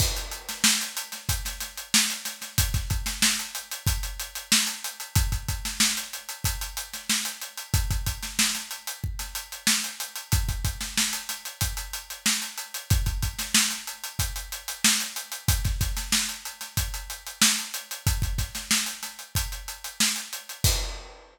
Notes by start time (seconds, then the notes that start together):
0.00 kick, crash
0.17 closed hi-hat
0.31 closed hi-hat
0.49 snare, closed hi-hat
0.64 snare
0.81 closed hi-hat
0.97 closed hi-hat
1.12 snare, closed hi-hat
1.29 kick, closed hi-hat
1.45 snare, closed hi-hat
1.60 snare, closed hi-hat
1.77 closed hi-hat
1.94 snare
2.10 closed hi-hat
2.25 snare, closed hi-hat
2.42 snare, closed hi-hat
2.58 kick, closed hi-hat
2.74 kick, snare, closed hi-hat
2.90 kick, closed hi-hat
3.06 snare, closed hi-hat
3.22 snare
3.39 closed hi-hat
3.55 closed hi-hat
3.72 closed hi-hat
3.87 kick, closed hi-hat
4.03 closed hi-hat
4.19 closed hi-hat
4.35 closed hi-hat
4.52 snare
4.67 closed hi-hat
4.84 closed hi-hat
5.00 closed hi-hat
5.15 kick, closed hi-hat
5.32 kick, closed hi-hat
5.49 kick, closed hi-hat
5.65 snare, closed hi-hat
5.80 snare
5.97 closed hi-hat
6.13 closed hi-hat
6.29 closed hi-hat
6.44 kick, closed hi-hat
6.61 closed hi-hat
6.77 closed hi-hat
6.93 snare, closed hi-hat
7.10 snare
7.25 closed hi-hat
7.42 closed hi-hat
7.58 closed hi-hat
7.74 kick, closed hi-hat
7.91 kick, closed hi-hat
8.06 kick, closed hi-hat
8.23 snare, closed hi-hat
8.39 snare
8.55 snare, closed hi-hat
8.71 closed hi-hat
8.87 closed hi-hat
9.04 kick
9.19 snare, closed hi-hat
9.35 closed hi-hat
9.52 closed hi-hat
9.67 snare
9.84 closed hi-hat
10.00 closed hi-hat
10.16 closed hi-hat
10.32 kick, closed hi-hat
10.49 kick, closed hi-hat
10.65 kick, closed hi-hat
10.81 snare, closed hi-hat
10.97 snare
11.13 closed hi-hat
11.29 snare, closed hi-hat
11.45 closed hi-hat
11.61 kick, closed hi-hat
11.77 closed hi-hat
11.93 closed hi-hat
12.10 closed hi-hat
12.26 snare
12.42 closed hi-hat
12.58 closed hi-hat
12.74 closed hi-hat
12.90 kick, closed hi-hat
13.06 kick, closed hi-hat
13.22 kick, closed hi-hat
13.39 snare, closed hi-hat
13.54 snare
13.71 snare, closed hi-hat
13.87 closed hi-hat
14.04 closed hi-hat
14.19 kick, closed hi-hat
14.36 closed hi-hat
14.52 closed hi-hat
14.68 closed hi-hat
14.84 snare
15.00 closed hi-hat
15.16 closed hi-hat
15.32 closed hi-hat
15.48 kick, closed hi-hat
15.65 kick, snare, closed hi-hat
15.81 kick, snare, closed hi-hat
15.97 snare, closed hi-hat
16.12 snare
16.29 closed hi-hat
16.45 closed hi-hat
16.61 snare, closed hi-hat
16.77 kick, closed hi-hat
16.94 closed hi-hat
17.10 closed hi-hat
17.27 closed hi-hat
17.42 snare
17.59 closed hi-hat
17.74 closed hi-hat
17.91 closed hi-hat
18.07 kick, closed hi-hat
18.22 kick, closed hi-hat
18.38 kick, snare, closed hi-hat
18.55 snare, closed hi-hat
18.71 snare
18.86 closed hi-hat
19.03 snare, closed hi-hat
19.19 closed hi-hat
19.35 kick, closed hi-hat
19.52 closed hi-hat
19.68 closed hi-hat
19.84 closed hi-hat
20.00 snare
20.16 closed hi-hat
20.33 closed hi-hat
20.49 closed hi-hat
20.64 kick, crash